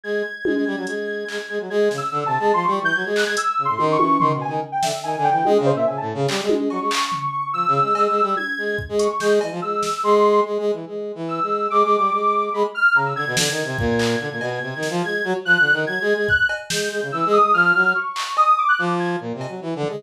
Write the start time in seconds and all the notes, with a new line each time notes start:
0.04 G#3 G#6
0.45 G#3, high tom
0.55 G#3
0.66 G3
0.77 F#3
0.87 G#3, closed hi-hat
1.28 G#3, clap
1.49 G#3
1.60 F#3
1.70 G#3 G#6
1.91 C#3, snare
1.97 E6
2.12 D3
2.26 C3 A5
2.39 G#3
2.53 F3 C6
2.64 G3 C#6
2.81 E3 G6
2.95 F#3 G#6
3.05 G#3
3.16 F#6, clap
3.26 G#3 G#6
3.37 E6, closed hi-hat
3.58 C#3
3.65 A2 C6
3.78 D#3, high tom
3.92 C#6
3.99 E3, high tom
4.20 D#3 C6, floor tom
4.34 B2
4.41 G#5
4.48 D#3
4.72 G5
4.83 D3 E5, snare
5.03 D#3 G#5
5.17 D3
5.24 G5
5.31 E3
5.45 G#3 D#5, high tom
5.59 C#3
5.66 C5
5.73 A#2 E5
5.87 C#3 G#5
5.97 A2 A5
6.14 C#3
6.28 G3, clap
6.42 G#3
6.49 high tom
6.56 G#3
6.70 F#3 C#6, cowbell
6.81 G#3
6.91 clap
7.12 floor tom
7.53 F3 E6
7.67 C#3
7.81 G#3
7.95 G#3, cowbell
8.09 G#3
8.22 G3
8.37 G#6, high tom
8.58 G#3
8.78 kick
8.89 G#3
8.99 C#6, closed hi-hat
9.20 G#3 G6, snare
9.41 E3, cowbell
9.51 F3
9.62 G#3 E6
9.83 snare
10.03 G#3 C6
10.45 G#3
10.59 G#3
10.73 E3
10.87 G#3
11.15 E3
11.28 E6
11.42 G#3
11.70 G#3 D6
11.84 G#3
11.98 G3
12.12 G#3
12.53 G#3 B5
12.75 F6
12.95 C#3 A#5
13.06 E6
13.16 D3 G#6
13.27 B2
13.37 D3 G#6, snare
13.51 D#3
13.64 C3
13.78 A#2, kick
13.99 clap
14.20 D3
14.31 A#2
14.41 B2, cowbell
14.62 C3
14.76 D#3
14.83 snare
14.90 F3
15.03 G#3 G#6
15.24 F#3
15.45 F3 F#6
15.59 D3
15.73 D#3
15.87 F#3 G#6
16.01 G#3
16.14 G#3
16.28 F#6, kick
16.49 cowbell
16.70 G#3 G6, snare
16.91 G#3
17.02 C#3
17.12 E3 E6
17.26 G#3
17.33 D#6
17.40 G#3
17.54 F3 F6
17.74 F#3
17.95 C#6
18.16 clap
18.37 D#6, cowbell
18.58 D6
18.68 F#6
18.79 F3 D6
18.99 G#6
19.20 A#2
19.34 C3
19.41 cowbell
19.48 F#3
19.62 E3
19.76 D3
19.83 floor tom
19.89 G#3